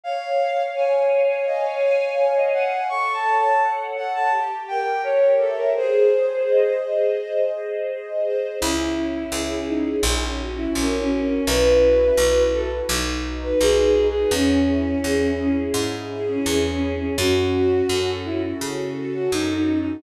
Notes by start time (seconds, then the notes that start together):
0.04 C#5 F5
0.40 F5
0.75 C#5 G#5
1.11 C#5
1.29 C#5
1.46 D#5 F5
1.64 C#5
1.83 G#5
2.17 C#5
2.36 D#5
2.53 F5 F#5
2.89 A4 C#6
3.13 A5
3.25 C#5
3.37 A5
3.62 F#5
3.95 A4 F#5
4.14 A5
4.31 G4
4.68 A#4 G5
5.03 C#5
5.39 A4 E5
5.57 A#4
5.75 G#4 C5
6.11 C5
6.48 D#5
6.83 G#4
7.18 C5
7.53 D#5
7.89 G#4
8.25 C5
8.60 C#2 C#4 E4
8.95 E4
9.32 C#2 G#4
9.67 C#4 D#4
10.03 A#1 C#4
10.38 F#4
10.57 E4
10.75 A#1 C#4 A#4
10.99 C#4
11.11 C#4
11.23 C#4
11.46 B1 E4 B4
11.82 F#4
12.17 B1 B4
12.53 E4 A4
12.89 B1 D#4
13.24 F#4
13.43 B4
13.61 B1 G#4 B4
13.85 G#4
13.97 D#4
14.08 G#4
14.31 E2 C#4
14.68 E4
15.04 E2 G#4
15.39 C#4
15.74 G#2 E4
16.10 G#4
16.29 C#4
16.46 E2 C#4
16.70 C#4
16.82 E4
16.94 C#4
17.18 F#2 C#4 F#4
17.53 F#4
17.89 F#2 A4
18.25 C#4 E4
18.60 C#3 F#4
18.98 A4
19.14 F#4
19.32 F#2 C#4 D#4
19.56 D#4
19.69 F#4
19.80 D#4